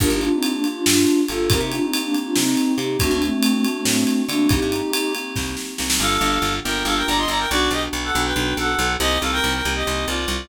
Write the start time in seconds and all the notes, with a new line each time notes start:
0.00 G1 A#3 D4 F4 G4 A#4, kick, crash
0.10 G1 D#4 G4
0.21 A#3 D4 F4 G4, ride
0.32 C4 D#4
0.42 A#3 D4 F4 G4, ride
0.54 A#3 D4
0.64 A#3 D4 F4 G4, ride
0.75 D4 F4
0.85 G2 D4 F4, snare
1.07 ride
1.28 G1 A#3 D4 F4 G4 A4, ride
1.50 C2 A#3 C4 D#4 G4 A#4, kick, ride
1.60 C3 D#4 G4
1.72 A#3 C4 D4 D#4 F4 G4, ride
1.82 C4 D#4
1.93 A#3 C4 D#4 G4, ride
2.03 A#3 D4
2.12 A#3 C4 D#4 G4, ride
2.25 D4 F4
2.36 C3 C4 D#4, snare
2.57 ride
2.77 C3 A#3 C4 D#4 G4, ride
2.99 D2 A3 C4 D4 F#4, kick, ride
3.11 D2 A#3 D4
3.21 A3 C4 D4 F#4, ride
3.32 A3 C4
3.42 A3 C4 D4 F#4, ride
3.54 A3 C4
3.64 A3 C4 D4 F#4, ride
3.75 A3 C4
3.85 A2 A3 C4, snare
4.07 ride
4.28 D3 A3 A#3 C4 D4 F#4, ride
4.49 C2 A#3 C4 D#4 G4, kick, ride
4.62 G2
4.72 A#3 C4 D#4 G4, ride
4.91 A#3 C4 D#4 G4, ride
5.14 A#3 C4 D#4 G4, ride
5.36 C2, kick, snare
5.57 snare
5.78 C2 A#3 C4 D#4 G4, snare
5.90 snare
5.99 G1 A#3 D4 F4 G4 A4 F5
6.21 G1 A#3 D4 F4 G4
6.42 G1
6.64 G1 A#3 D4 F4 G4 A#4 G5
6.85 G1 A#3 D4 F4 G4 A4 F5
6.96 A#4 G5
7.07 G1 D5 A#5
7.18 D#5 C6
7.28 G1 D5 A#5
7.39 A#4 G5
7.50 B1 B3 D4 F#4 D5
7.71 B1 B3 D4 F#4 G4 D#5
7.93 B1
8.04 A4 F#5
8.13 B1 B3 D4 F#4
8.25 B4 G5
8.35 B1 B3 D4 F#4
8.57 B1 A4 F#5
8.79 B1
9.00 C2 A#3 C4 D#4 G4 D#5
9.21 C2 A#3 C4 D#4 G4 A4 F5
9.32 A#4 G5
9.44 C2
9.53 A#4 G5
9.65 C2 A#3 C4 D#4 G4
9.75 G4 D#5
9.85 C2 A#3 C4 D#4 G4
10.07 C2 F4 D5
10.28 C2